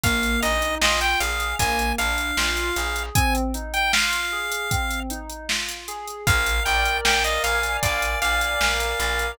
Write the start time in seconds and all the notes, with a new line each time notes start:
0.04 A#1 A#3 F5, kick, closed hi-hat
0.23 closed hi-hat
0.42 A#1 D#4 D#5, closed hi-hat
0.62 closed hi-hat
0.81 A#1 F4 D#5, snare
1.01 G5, closed hi-hat
1.20 A#1 G#4 F5, closed hi-hat
1.40 closed hi-hat
1.59 A#1 A#3 G#5, kick, closed hi-hat
1.79 closed hi-hat
1.98 A#1 D4 F5, closed hi-hat
2.18 closed hi-hat
2.37 A#1 F4, snare
2.57 closed hi-hat
2.76 A#1 G#4, closed hi-hat
2.96 closed hi-hat
3.15 C4 G#5, kick, closed hi-hat
3.35 closed hi-hat
3.54 D#4, closed hi-hat
3.74 G5, closed hi-hat
3.93 F4 F5, snare
4.13 closed hi-hat
4.32 G#4
4.52 closed hi-hat
4.71 C4, kick, closed hi-hat
4.91 closed hi-hat
5.10 D#4, closed hi-hat
5.30 closed hi-hat
5.49 F4, snare
5.69 closed hi-hat
5.88 G#4, closed hi-hat
6.07 closed hi-hat
6.27 A#1 A#4 F5, kick, closed hi-hat
6.46 closed hi-hat
6.65 A#1 D5 G5, closed hi-hat
6.85 closed hi-hat
7.05 A#1 F5 G5, snare
7.24 D#5, closed hi-hat
7.43 A#1 F5 G#5, closed hi-hat
7.63 closed hi-hat
7.83 A#1 D5 F5, kick, closed hi-hat
8.02 closed hi-hat
8.21 A#1 D5 F5, closed hi-hat
8.41 closed hi-hat
8.61 A#1 A#4, snare
8.80 closed hi-hat
9.00 A#1 D5, closed hi-hat
9.19 closed hi-hat